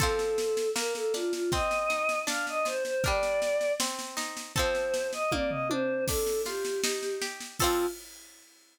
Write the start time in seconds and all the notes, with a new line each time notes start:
0.00 F3 C4 A4, kick, snare
0.19 snare
0.38 snare
0.57 snare
0.75 A#3 A#4, snare
0.95 A4, snare
1.14 D4 F4, snare
1.33 F4, snare
1.52 C4 D#5, kick, snare
1.71 snare
1.90 D#4, snare
2.09 snare
2.27 D4 F5, snare
2.47 D#5, snare
2.65 F4 C5, snare
2.85 C5, snare
3.04 G3 D4 A#4 D5, kick, snare
3.23 snare
3.42 snare
3.61 snare
3.80 C4, snare
3.99 snare
4.17 D#4, snare
4.37 snare
4.55 C4 A4 C5, kick, snare
4.59 F3
4.75 snare
4.94 snare
5.13 D#5, snare
5.32 A#3 D5, kick, high tom
5.50 D#5, floor tom
5.70 D4 C5, high tom
6.08 D4 A4, kick, snare, crash
6.27 snare
6.45 F4 G4, snare
6.65 snare
6.84 D#4, snare
7.03 snare
7.22 G4, snare
7.41 snare
7.59 C4 F4 A4, kick, crash
7.64 F3